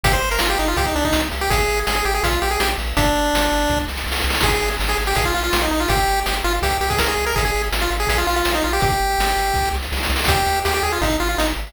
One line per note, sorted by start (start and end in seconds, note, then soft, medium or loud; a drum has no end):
0.03 0.19 G1 loud
0.03 0.13 G4 loud
0.03 kick loud
0.03 closed hi-hat loud
0.12 0.29 C5 medium
0.12 closed hi-hat medium
0.22 0.38 G1 loud
0.22 closed hi-hat medium
0.30 0.40 A#4 medium
0.30 closed hi-hat medium
0.39 0.56 G1 loud
0.39 0.49 F4 medium
0.39 snare loud
0.50 0.58 G4 medium
0.50 closed hi-hat medium
0.58 0.75 G1 loud
0.58 0.68 D#4 medium
0.58 closed hi-hat medium
0.67 0.77 F4 medium
0.67 closed hi-hat medium
0.77 0.92 C2 loud
0.77 0.86 G4 medium
0.77 kick medium
0.77 closed hi-hat medium
0.86 0.95 D#4 medium
0.86 closed hi-hat medium
0.95 1.11 C2 medium
0.95 1.04 D4 loud
0.95 closed hi-hat medium
1.03 1.21 D#4 medium
1.03 kick medium
1.03 closed hi-hat medium
1.13 1.29 C2 loud
1.13 snare loud
1.24 closed hi-hat medium
1.32 1.48 C2 loud
1.32 closed hi-hat medium
1.41 1.50 G4 medium
1.41 closed hi-hat medium
1.50 1.66 G#1 loud
1.50 1.80 G#4 loud
1.50 kick loud
1.50 closed hi-hat loud
1.60 closed hi-hat medium
1.68 1.84 G#1 medium
1.68 closed hi-hat medium
1.77 closed hi-hat medium
1.87 2.03 G#1 medium
1.87 1.95 G#4 medium
1.87 snare loud
1.95 2.05 G#4 medium
1.95 closed hi-hat medium
2.05 2.21 G#1 medium
2.05 2.14 G4 medium
2.05 closed hi-hat medium
2.14 2.23 G#4 medium
2.14 closed hi-hat medium
2.23 2.39 A#1 loud
2.23 2.40 F4 medium
2.23 kick medium
2.23 closed hi-hat loud
2.33 closed hi-hat medium
2.42 2.57 A#1 medium
2.42 2.50 G4 medium
2.42 closed hi-hat medium
2.50 2.60 G#4 medium
2.50 closed hi-hat medium
2.60 2.75 A#1 medium
2.60 2.69 G4 medium
2.60 snare loud
2.69 closed hi-hat medium
2.78 2.93 A#1 loud
2.78 closed hi-hat medium
2.87 closed hi-hat medium
2.97 3.12 G1 loud
2.97 3.79 D4 loud
2.97 kick loud
2.97 closed hi-hat loud
3.06 closed hi-hat medium
3.15 3.31 G1 medium
3.15 closed hi-hat medium
3.25 closed hi-hat medium
3.33 3.49 G1 loud
3.33 snare loud
3.42 closed hi-hat medium
3.52 3.67 G1 loud
3.52 closed hi-hat medium
3.60 closed hi-hat medium
3.68 3.85 C2 loud
3.68 kick medium
3.68 snare medium
3.80 snare medium
3.88 4.04 C2 medium
3.88 snare medium
3.97 snare medium
4.06 4.22 C2 loud
4.06 snare medium
4.12 snare medium
4.16 snare medium
4.21 snare medium
4.24 4.40 C2 loud
4.24 snare medium
4.30 snare medium
4.34 snare medium
4.40 4.59 G#1 loud
4.40 4.52 G#4 loud
4.40 kick loud
4.40 snare loud
4.40 crash medium
4.52 4.70 G#4 medium
4.52 closed hi-hat medium
4.62 4.77 G#1 medium
4.62 closed hi-hat medium
4.71 closed hi-hat medium
4.79 4.95 G#1 loud
4.79 snare medium
4.88 4.97 G#4 medium
4.88 closed hi-hat medium
4.97 5.13 G#1 loud
4.97 closed hi-hat medium
5.06 5.16 G4 medium
5.06 closed hi-hat medium
5.15 5.32 A#1 loud
5.15 5.25 G#4 medium
5.15 kick medium
5.15 closed hi-hat loud
5.25 5.34 F4 medium
5.25 closed hi-hat medium
5.34 5.50 A#1 medium
5.34 5.43 F4 medium
5.34 closed hi-hat medium
5.43 5.60 F4 medium
5.43 closed hi-hat medium
5.53 5.69 A#1 loud
5.53 snare loud
5.61 5.71 D#4 medium
5.61 closed hi-hat medium
5.71 5.86 A#1 medium
5.71 5.80 D#4 medium
5.71 closed hi-hat medium
5.80 5.89 F4 medium
5.80 closed hi-hat medium
5.88 6.05 G1 loud
5.88 6.20 G4 loud
5.88 kick loud
5.88 closed hi-hat loud
5.99 closed hi-hat medium
6.08 6.23 G1 loud
6.08 closed hi-hat medium
6.17 closed hi-hat medium
6.26 6.42 G1 medium
6.26 6.35 G4 medium
6.26 snare loud
6.36 closed hi-hat medium
6.44 6.60 G1 loud
6.44 6.53 F4 loud
6.44 closed hi-hat medium
6.55 closed hi-hat medium
6.62 6.78 C2 loud
6.62 6.77 G4 medium
6.62 kick medium
6.62 closed hi-hat loud
6.70 closed hi-hat medium
6.80 6.96 C2 loud
6.80 6.89 G4 medium
6.80 closed hi-hat medium
6.90 6.99 G#4 medium
6.90 kick medium
6.90 closed hi-hat medium
6.98 7.15 C2 medium
6.98 7.08 A#4 medium
6.98 snare loud
7.08 7.25 G#4 medium
7.08 closed hi-hat medium
7.17 7.33 C2 loud
7.17 closed hi-hat medium
7.26 7.35 A#4 medium
7.26 closed hi-hat medium
7.36 7.51 G#1 loud
7.36 7.44 G#4 medium
7.36 kick loud
7.36 closed hi-hat loud
7.45 7.62 G#4 medium
7.45 closed hi-hat medium
7.54 7.70 G#1 loud
7.54 closed hi-hat medium
7.64 closed hi-hat medium
7.72 7.88 G#1 loud
7.72 snare loud
7.81 7.90 F4 medium
7.81 closed hi-hat medium
7.90 8.06 G#1 loud
7.90 closed hi-hat medium
8.00 8.08 G#4 medium
8.00 closed hi-hat medium
8.07 8.24 A#1 loud
8.07 8.17 G#4 medium
8.07 kick medium
8.07 closed hi-hat loud
8.18 8.27 F4 medium
8.18 closed hi-hat medium
8.27 8.43 A#1 medium
8.27 8.36 F4 loud
8.27 closed hi-hat medium
8.36 8.52 F4 medium
8.36 closed hi-hat medium
8.45 8.61 A#1 medium
8.45 snare loud
8.55 8.63 D#4 medium
8.55 closed hi-hat medium
8.62 8.80 A#1 loud
8.62 8.72 F4 medium
8.62 closed hi-hat medium
8.73 8.82 G4 loud
8.73 closed hi-hat medium
8.80 8.98 G1 loud
8.80 9.69 G4 loud
8.80 kick loud
8.80 closed hi-hat medium
8.92 closed hi-hat medium
9.00 9.16 G1 medium
9.10 closed hi-hat medium
9.19 9.34 G1 loud
9.19 snare loud
9.30 closed hi-hat medium
9.37 9.52 G1 medium
9.37 closed hi-hat medium
9.47 closed hi-hat medium
9.54 9.71 C2 loud
9.54 kick medium
9.54 snare medium
9.65 snare medium
9.73 9.89 C2 loud
9.73 snare medium
9.82 snare medium
9.92 10.08 C2 loud
9.92 snare medium
9.97 snare medium
10.03 snare medium
10.05 snare medium
10.09 10.25 C2 loud
10.09 snare medium
10.16 snare loud
10.19 snare medium
10.24 10.43 D#2 loud
10.24 kick loud
10.24 snare loud
10.28 10.60 G4 loud
10.28 closed hi-hat loud
10.36 closed hi-hat medium
10.46 10.62 D#2 medium
10.46 closed hi-hat medium
10.56 closed hi-hat medium
10.65 10.81 D#2 medium
10.65 10.74 G4 loud
10.65 snare loud
10.74 10.83 G4 loud
10.74 closed hi-hat medium
10.83 10.98 D#2 medium
10.83 10.92 G#4 medium
10.83 closed hi-hat medium
10.92 11.01 F4 medium
10.92 closed hi-hat medium
11.01 11.17 G#1 loud
11.01 11.17 D#4 medium
11.01 kick medium
11.01 closed hi-hat medium
11.12 closed hi-hat medium
11.20 11.36 G#1 loud
11.20 11.28 F4 medium
11.20 closed hi-hat medium
11.29 11.38 F4 medium
11.29 closed hi-hat medium
11.38 11.54 G#1 loud
11.38 11.47 D#4 medium
11.38 snare loud
11.48 closed hi-hat medium
11.56 11.72 G#1 medium
11.56 closed hi-hat medium
11.67 closed hi-hat medium